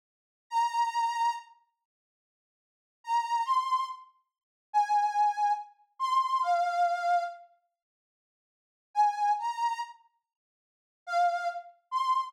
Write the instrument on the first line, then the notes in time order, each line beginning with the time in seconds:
accordion
0.50 A#5
3.04 A#5
3.45 C6
4.73 G#5
5.99 C6
6.42 F5
8.94 G#5
9.39 A#5
11.06 F5
11.91 C6